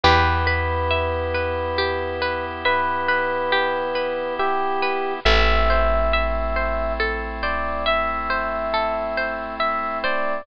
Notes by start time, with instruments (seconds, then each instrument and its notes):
0.03 electric bass (finger) E2, drawbar organ B3 E4 G4, orchestral harp G4, electric piano 1 B4
0.47 orchestral harp B4
0.91 orchestral harp E5
1.34 orchestral harp B4
1.78 orchestral harp G4
2.22 orchestral harp B4
2.65 electric piano 1 B4, orchestral harp E5
3.08 orchestral harp B4
3.52 orchestral harp G4
3.95 orchestral harp B4
4.39 electric piano 1 G4, orchestral harp E5
4.82 orchestral harp B4
5.25 electric bass (finger) A1, drawbar organ A3 C4 E4, orchestral harp A4, electric piano 1 E5
5.70 orchestral harp C5
6.13 orchestral harp E5
6.56 orchestral harp C5
7.00 orchestral harp A4
7.43 orchestral harp C5, electric piano 1 D5
7.86 orchestral harp E5, electric piano 1 E5
8.30 orchestral harp C5
8.74 orchestral harp A4
9.17 orchestral harp C5
9.60 electric piano 1 E5, orchestral harp E5
10.04 orchestral harp C5, electric piano 1 D5